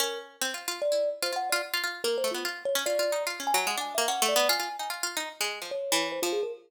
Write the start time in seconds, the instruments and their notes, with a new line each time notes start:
0.00 harpsichord C#4, kalimba A#4
0.41 harpsichord C4
0.54 harpsichord F4
0.68 harpsichord F4
0.82 kalimba D5
0.92 harpsichord E4
1.22 harpsichord F4, kalimba C5
1.32 harpsichord F4, kalimba F#5
1.50 harpsichord F4, kalimba D5
1.74 harpsichord F4
1.84 harpsichord F4
2.04 harpsichord A#3, kalimba A#4
2.18 kalimba C5
2.24 harpsichord A3
2.31 harpsichord B3, kalimba F4
2.45 harpsichord F4
2.65 kalimba C#5
2.75 harpsichord C#4
2.86 harpsichord F4, kalimba D5
2.99 harpsichord F4
3.12 harpsichord D#4
3.27 harpsichord F4
3.40 harpsichord C#4
3.47 kalimba G#5
3.54 harpsichord F#3, kalimba G#5
3.67 harpsichord G#3, kalimba F#5
3.77 harpsichord D4, kalimba G#5
3.95 harpsichord A#3, kalimba E5
4.08 harpsichord C#4, kalimba F#5
4.22 harpsichord A3
4.29 kalimba D5
4.36 harpsichord B3
4.49 harpsichord F4, kalimba G#5
4.60 harpsichord F4
4.79 harpsichord D#4, kalimba G#5
4.90 harpsichord F4
5.03 harpsichord F4
5.17 harpsichord D#4
5.41 harpsichord G#3
5.62 harpsichord F3
5.71 kalimba C#5
5.92 harpsichord E3
6.12 kalimba C5
6.22 harpsichord F3, kalimba F4
6.33 kalimba G#4
6.43 kalimba A#4